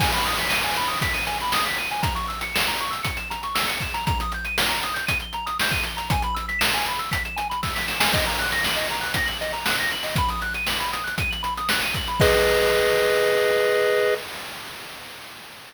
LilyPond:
<<
  \new Staff \with { instrumentName = "Lead 1 (square)" } { \time 4/4 \key gis \minor \tempo 4 = 118 gis''16 b''16 dis'''16 b'''16 dis''''16 gis''16 b''16 dis'''16 b'''16 dis''''16 gis''16 b''16 dis'''16 b'''16 dis''''16 gis''16 | ais''16 cis'''16 e'''16 cis''''16 e''''16 ais''16 cis'''16 e'''16 cis''''16 e''''16 ais''16 cis'''16 e'''16 cis''''16 e''''16 ais''16 | ais''16 dis'''16 g'''16 dis''''16 g''''16 ais''16 dis'''16 g'''16 dis''''16 g''''16 ais''16 dis'''16 g'''16 dis''''16 g''''16 ais''16 | gis''16 b''16 e'''16 b'''16 e''''16 gis''16 b''16 e'''16 b'''16 e''''16 gis''16 b''16 e'''16 b'''16 e''''16 gis''16 |
dis''16 ais''16 fis'''16 ais'''16 fis''''16 dis''16 ais''16 fis'''16 ais'''16 fis''''16 dis''16 ais''16 fis'''16 ais'''16 fis''''16 dis''16 | b''16 dis'''16 fis'''16 dis''''16 fis''''16 b''16 dis'''16 fis'''16 dis''''16 fis''''16 b''16 dis'''16 fis'''16 dis''''16 fis''''16 b''16 | <gis' b' dis''>1 | }
  \new DrumStaff \with { instrumentName = "Drums" } \drummode { \time 4/4 <cymc bd>16 hh16 hh16 hh16 sn16 hh16 hh16 hh16 <hh bd>16 hh16 hh16 hh16 sn16 hh16 hh16 hh16 | <hh bd>16 hh16 hh16 hh16 sn16 hh16 hh16 hh16 <hh bd>16 hh16 hh16 hh16 sn16 hh16 <hh bd>16 hh16 | <hh bd>16 hh16 hh16 hh16 sn16 hh16 hh16 hh16 <hh bd>16 hh16 hh16 hh16 sn16 <hh bd>16 hh16 hh16 | <hh bd>16 hh16 hh16 hh16 sn16 hh16 hh16 hh16 <hh bd>16 hh16 hh16 hh16 <bd sn>16 sn16 sn16 sn16 |
<cymc bd>16 hh16 hh16 hh16 sn16 hh16 hh16 hh16 <hh bd>16 hh16 hh16 hh16 sn16 hh16 hh16 hho16 | <hh bd>16 hh16 hh16 hh16 sn16 hh16 hh16 hh16 <hh bd>16 hh16 hh16 hh16 sn16 hh16 <hh bd>16 hh16 | <cymc bd>4 r4 r4 r4 | }
>>